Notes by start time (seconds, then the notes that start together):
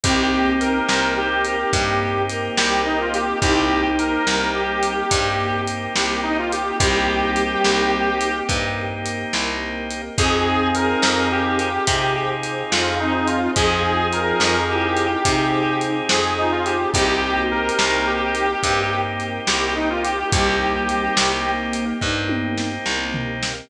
0.04 C2 A#3 C4 D#4 G4, kick, closed hi-hat
0.61 A#4, closed hi-hat
0.88 C2 C5, snare
1.17 G4 C5
1.45 A#4, closed hi-hat
1.73 G2 A#3 C4 D#4 G4 A#4, kick, closed hi-hat
2.29 A#4, closed hi-hat
2.57 C2 G4, snare
2.85 D#4
3.01 F4
3.14 G4, closed hi-hat
3.42 C2 A#3 C4 D#4 G4, kick, closed hi-hat
3.98 A#4, closed hi-hat
4.27 C2 G3, snare
4.55 G4
4.83 closed hi-hat
5.10 G2 A#3 C4 D#4 G4 A#4, kick, closed hi-hat
5.67 closed hi-hat
5.96 C2 G4, snare
6.23 D#4
6.38 F4
6.52 G4, closed hi-hat
6.80 C2 G3 A#3 C4 D#4 G4, kick, closed hi-hat
7.36 closed hi-hat
7.64 C2, snare
8.21 closed hi-hat
8.49 G2 A#3 C4 D#4 G4 A#4, kick, closed hi-hat
9.06 closed hi-hat
9.33 C2, snare
9.90 closed hi-hat
10.18 F2 C4 D#4 F4 G#4, kick, closed hi-hat
10.75 A#4, closed hi-hat
11.02 F2, snare
11.31 G4
11.59 closed hi-hat
11.87 C3 C4 D#4 F4 G#4 C5, kick, closed hi-hat
12.43 closed hi-hat
12.71 F2 F4, snare
13.00 C4 D#4
13.14 D#4
13.27 F4, closed hi-hat
13.56 F2 F3 C4 D#4 F4 G#4, kick, closed hi-hat
14.13 A#4, closed hi-hat
14.40 F2, snare
14.70 E4 G4
14.97 closed hi-hat
15.24 C3 C4 D#4 F4 G#4 C5, kick, closed hi-hat
15.81 closed hi-hat
16.09 F2 G#4, snare
16.38 D#4 F4
16.52 F4
16.66 F4 G4, closed hi-hat
16.93 C2 A#3 C4 D#4 G4, kick, closed hi-hat
17.37 F#4
17.51 G4 A#4
17.69 closed hi-hat
17.79 C2, snare
18.06 G4
18.35 closed hi-hat
18.63 G2 A#3 C4 D#4 G4 A#4, kick, closed hi-hat
19.20 closed hi-hat
19.47 C2 G4, snare
19.76 D#4
19.90 F4
20.04 G4, closed hi-hat
20.32 C2 G3 A#3 C4 D#4 G4, kick, closed hi-hat
20.88 G3, closed hi-hat
21.17 C2, snare
21.45 A#3
21.73 closed hi-hat
22.01 G2 A#3 C4 D#4 G4 A#4, kick
22.29 high tom
22.58 snare
22.86 C2, snare
23.14 floor tom
23.43 snare